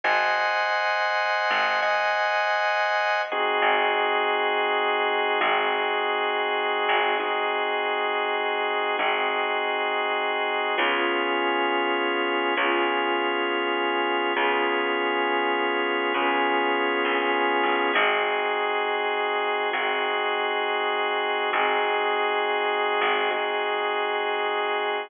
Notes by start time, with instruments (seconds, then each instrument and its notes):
0.04 electric bass (finger) G#1, drawbar organ C5 D#5 F#5 G#5
1.50 electric bass (finger) G#1
1.82 drawbar organ C5 D#5 F#5 G#5
3.32 drawbar organ C4 D#4 F#4 G#4
3.62 electric bass (finger) G#1
5.41 electric bass (finger) G#1, drawbar organ C4 D#4 F#4 G#4
6.89 electric bass (finger) G#1
7.20 drawbar organ C4 D#4 F#4 G#4
8.99 electric bass (finger) G#1, drawbar organ C4 D#4 F#4 G#4
10.78 electric bass (finger) C#2, drawbar organ B3 C#4 F4 G#4
12.57 electric bass (finger) C#2, drawbar organ B3 C#4 F4 G#4
14.36 electric bass (finger) C#2, drawbar organ B3 C#4 F4 G#4
16.14 electric bass (finger) C#2, drawbar organ B3 C#4 F4 G#4
17.05 electric bass (finger) A#1
17.63 electric bass (finger) A1
17.93 electric bass (finger) G#1, drawbar organ C4 D#4 F#4 G#4
19.73 electric bass (finger) G#1, drawbar organ C4 D#4 F#4 G#4
21.53 electric bass (finger) G#1, drawbar organ C4 D#4 F#4 G#4
23.01 electric bass (finger) G#1
23.31 drawbar organ C4 D#4 F#4 G#4